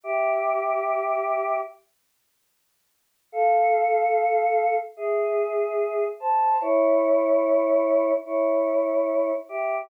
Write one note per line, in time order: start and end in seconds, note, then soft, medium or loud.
0.03 1.57 G4 loud
0.03 1.57 E5 loud
3.32 4.74 A4 loud
3.32 4.74 F5 loud
4.97 6.04 G#4 medium
4.97 6.04 E5 medium
6.20 6.59 C5 medium
6.20 6.59 A5 medium
6.61 8.12 E4 loud
6.61 8.12 C#5 loud
8.25 9.32 E4 medium
8.25 9.32 C#5 loud
9.49 9.82 G4 medium
9.49 9.82 E5 medium